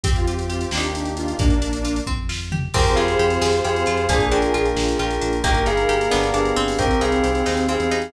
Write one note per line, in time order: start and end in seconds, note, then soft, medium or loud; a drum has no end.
0.04 0.66 F2 medium
0.04 0.69 C4 medium
0.04 0.72 C4 loud
0.04 0.72 F4 loud
0.04 0.14 G4 medium
0.04 0.72 G4 loud
0.04 kick loud
0.04 closed hi-hat loud
0.15 0.26 F4 medium
0.15 closed hi-hat medium
0.27 0.70 F4 medium
0.27 0.37 G4 medium
0.27 closed hi-hat medium
0.37 0.48 G4 medium
0.37 closed hi-hat medium
0.50 0.61 F4 medium
0.50 0.71 G4 medium
0.50 closed hi-hat medium
0.61 0.89 G4 medium
0.61 closed hi-hat medium
0.71 1.34 D#2 medium
0.71 1.39 A#3 loud
0.71 1.33 A#3 medium
0.71 1.39 D4 loud
0.71 1.33 D4 medium
0.71 1.39 D#4 loud
0.71 1.39 G4 loud
0.71 snare loud
0.77 1.33 D#4 medium
0.77 1.33 G4 medium
0.83 closed hi-hat medium
0.93 1.12 G4 medium
0.93 closed hi-hat medium
1.05 closed hi-hat medium
1.17 1.35 F4 medium
1.17 closed hi-hat medium
1.28 closed hi-hat medium
1.38 2.00 A#1 medium
1.38 2.01 A#3 medium
1.38 2.04 A#3 medium
1.38 2.01 D4 medium
1.38 kick loud
1.38 closed hi-hat loud
1.50 closed hi-hat medium
1.62 2.04 D4 medium
1.62 closed hi-hat medium
1.73 closed hi-hat medium
1.85 2.06 F4 medium
1.85 closed hi-hat medium
1.96 closed hi-hat medium
2.07 2.69 F2 medium
2.07 2.71 C4 medium
2.07 kick medium
2.29 2.72 F4 medium
2.29 snare loud
2.52 2.73 G4 medium
2.52 floor tom loud
2.74 2.95 F2 loud
2.74 2.94 C4 loud
2.74 4.06 C4 medium
2.74 4.08 C4 medium
2.74 4.06 F4 medium
2.74 4.08 F4 medium
2.74 4.06 G4 medium
2.74 4.08 G4 medium
2.74 4.06 G#4 medium
2.74 4.08 G#4 medium
2.74 2.96 A#4 medium
2.74 4.05 C5 medium
2.74 2.96 G5 medium
2.74 kick loud
2.74 crash loud
2.86 closed hi-hat medium
2.96 3.16 F2 medium
2.96 3.17 F4 medium
2.96 3.50 G#4 medium
2.96 3.50 F5 medium
2.96 closed hi-hat medium
3.08 closed hi-hat medium
3.19 3.38 F2 medium
3.19 3.40 G4 medium
3.19 closed hi-hat medium
3.30 closed hi-hat medium
3.41 3.61 F2 medium
3.41 3.62 G#4 loud
3.41 snare loud
3.53 closed hi-hat medium
3.64 3.84 F2 medium
3.64 3.85 G4 medium
3.64 4.05 G#4 medium
3.64 4.05 F5 medium
3.64 closed hi-hat medium
3.76 closed hi-hat medium
3.86 4.07 F2 medium
3.86 4.07 F4 loud
3.86 closed hi-hat medium
3.97 closed hi-hat medium
4.09 4.28 A#1 medium
4.09 4.29 A#3 loud
4.09 5.42 A#3 medium
4.09 5.43 A#3 medium
4.09 5.42 D4 medium
4.09 5.43 D4 medium
4.09 5.42 F4 medium
4.09 5.43 F4 medium
4.09 4.66 G#4 loud
4.09 5.42 G#4 medium
4.09 5.43 G#4 medium
4.09 4.27 C5 medium
4.09 4.27 G#5 medium
4.09 kick loud
4.09 closed hi-hat loud
4.20 closed hi-hat medium
4.31 4.50 A#1 medium
4.31 4.52 D4 medium
4.31 4.95 A#4 medium
4.31 4.95 G5 medium
4.31 closed hi-hat medium
4.42 closed hi-hat medium
4.54 4.74 A#1 medium
4.54 4.74 F4 medium
4.54 closed hi-hat medium
4.66 closed hi-hat medium
4.75 4.95 A#1 medium
4.75 4.97 G#4 medium
4.75 snare loud
4.88 closed hi-hat medium
4.99 5.19 A#1 medium
4.99 5.20 F4 medium
4.99 5.37 A#4 medium
4.99 5.37 G5 medium
4.99 closed hi-hat medium
5.11 closed hi-hat medium
5.21 5.42 A#1 medium
5.21 5.42 D4 medium
5.21 closed hi-hat medium
5.33 closed hi-hat medium
5.43 5.63 G1 medium
5.43 6.10 A#3 medium
5.43 5.64 A#3 loud
5.43 6.10 A#3 medium
5.43 6.10 D#4 medium
5.43 6.10 G4 medium
5.43 6.52 A#4 medium
5.43 5.63 A#4 medium
5.43 5.63 G5 medium
5.43 kick loud
5.43 closed hi-hat loud
5.54 closed hi-hat medium
5.66 5.86 G1 medium
5.66 5.86 D#4 medium
5.66 6.24 G#4 medium
5.66 6.24 F5 medium
5.66 closed hi-hat medium
5.77 closed hi-hat medium
5.89 6.08 G1 medium
5.89 6.09 G4 medium
5.89 closed hi-hat medium
6.01 closed hi-hat medium
6.11 6.32 G1 medium
6.11 6.77 B3 medium
6.11 6.32 B3 loud
6.11 6.78 B3 medium
6.11 6.77 D4 medium
6.11 6.78 D4 medium
6.11 6.77 G4 medium
6.11 6.78 G4 medium
6.11 snare loud
6.23 closed hi-hat medium
6.34 6.53 G1 medium
6.34 6.54 D4 medium
6.34 6.76 G#4 medium
6.34 6.76 F5 medium
6.34 closed hi-hat medium
6.45 closed hi-hat medium
6.56 6.75 G1 medium
6.56 6.99 C4 loud
6.56 closed hi-hat medium
6.68 open hi-hat medium
6.78 6.97 C2 medium
6.78 8.12 C4 medium
6.78 7.94 C4 loud
6.78 8.11 C4 medium
6.78 8.12 D#4 medium
6.78 8.11 D#4 medium
6.78 8.12 G4 medium
6.78 8.11 G4 medium
6.78 7.01 A#4 medium
6.78 7.01 G5 medium
6.78 kick loud
6.78 closed hi-hat loud
6.91 closed hi-hat medium
7.01 7.21 C2 medium
7.01 7.21 D#4 medium
7.01 7.58 G#4 medium
7.01 7.58 F5 medium
7.01 closed hi-hat medium
7.12 closed hi-hat medium
7.24 7.43 C2 medium
7.24 7.44 G4 medium
7.24 closed hi-hat medium
7.35 closed hi-hat medium
7.46 7.77 D#2 medium
7.46 7.66 D#4 medium
7.46 snare medium
7.57 closed hi-hat medium
7.68 7.89 C4 medium
7.68 8.09 G#4 medium
7.68 8.09 F5 medium
7.68 closed hi-hat medium
7.80 8.10 E2 medium
7.80 closed hi-hat medium
7.91 8.12 D#4 loud
7.91 closed hi-hat medium
8.02 closed hi-hat medium